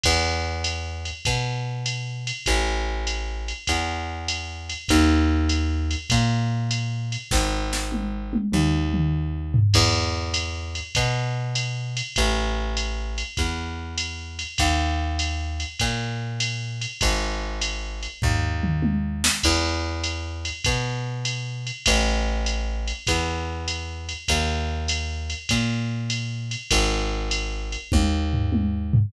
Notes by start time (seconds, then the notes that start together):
0.04 E2, kick, crash, ride
0.64 hi-hat pedal, ride
1.05 ride
1.25 B2, kick, ride
1.86 hi-hat pedal, ride
2.27 ride
2.46 A1, kick, ride
3.07 hi-hat pedal, ride
3.48 ride
3.67 E2, kick, ride
4.28 hi-hat pedal, ride
4.69 ride
4.88 D#2, kick, ride
5.49 hi-hat pedal, ride
5.91 ride
6.10 A#2, kick, ride
6.71 hi-hat pedal, ride
7.12 ride
7.31 G#1, kick, snare
7.73 snare
7.92 high tom
8.33 high tom
8.52 D#2, mid tom
8.94 mid tom
9.54 floor tom
9.74 E2, kick, crash, ride
10.34 hi-hat pedal, ride
10.75 ride
10.95 B2, kick, ride
11.55 hi-hat pedal, ride
11.97 ride
12.16 A1, kick, ride
12.77 hi-hat pedal, ride
13.18 ride
13.37 E2, kick, ride
13.98 hi-hat pedal, ride
14.39 ride
14.58 D#2, kick, ride
15.19 hi-hat pedal, ride
15.60 ride
15.79 A#2, kick, ride
16.40 hi-hat pedal, ride
16.81 ride
17.01 G#1, kick, ride
17.61 hi-hat pedal, ride
18.03 ride
18.22 D#2, kick, floor tom
18.63 mid tom
18.82 high tom
19.24 snare
19.43 E2, kick, crash, ride
20.04 hi-hat pedal, ride
20.45 ride
20.64 B2, kick, ride
21.25 hi-hat pedal, ride
21.67 ride
21.86 A1, kick, ride
22.46 hi-hat pedal, ride
22.88 ride
23.07 E2, kick, ride
23.68 hi-hat pedal, ride
24.09 ride
24.28 D#2, kick, ride
24.88 hi-hat pedal, ride
25.30 ride
25.49 A#2, kick, ride
26.10 hi-hat pedal, ride
26.51 ride
26.71 G#1, kick, ride
27.31 hi-hat pedal, ride
27.72 ride
27.92 D#2, kick, high tom
28.33 floor tom
28.52 high tom
28.93 floor tom